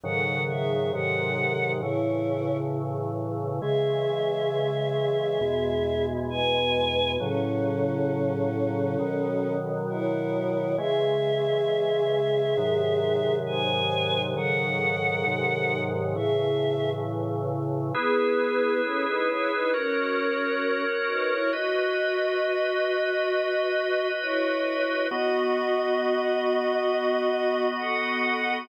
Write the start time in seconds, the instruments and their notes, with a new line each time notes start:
0.04 drawbar organ G#2 C#3 D#3 F#3, choir aahs A4 F#5
0.49 choir aahs G#4 E5
0.93 drawbar organ G#2 C3 D#3 F#3, choir aahs A4 F#5
1.82 drawbar organ A2 C#3 E3, choir aahs E4 C#5
3.61 drawbar organ C#3 E3 G#3, choir aahs G#4 E5
5.41 drawbar organ E2 B2 G#3
6.30 choir aahs B4 G#5
7.20 drawbar organ A2 C#3 F#3, choir aahs C#4 A4
8.99 drawbar organ B2 D#3 F#3
9.89 choir aahs E4 C#5
10.77 drawbar organ C#3 E3 G#3, choir aahs G#4 E5
12.57 drawbar organ G#2 C3 D#3 F#3
13.46 choir aahs C5 G#5
14.36 drawbar organ G#2 C#3 D#3 F#3, choir aahs A4 F#5
15.26 drawbar organ G#2 C3 D#3 F#3
16.15 drawbar organ A2 C#3 E3, choir aahs G#4 E5
17.94 choir aahs B3 G#4, drawbar organ E4 G#4 B4
18.84 choir aahs C#4 A4
19.07 choir aahs D#4 B4
19.29 choir aahs E4 C#5
19.51 choir aahs D#4 B4
19.74 choir aahs C#4 A#4, drawbar organ F#4 A#4 C#5
21.09 choir aahs D#4 B4
21.31 choir aahs E4 C#5
21.53 drawbar organ F#4 B4 D#5, choir aahs F#4 D#5
24.22 choir aahs E4 C#5
25.11 drawbar organ B3 F#4 D#5, choir aahs F#4 D#5
27.79 choir aahs A4 F#5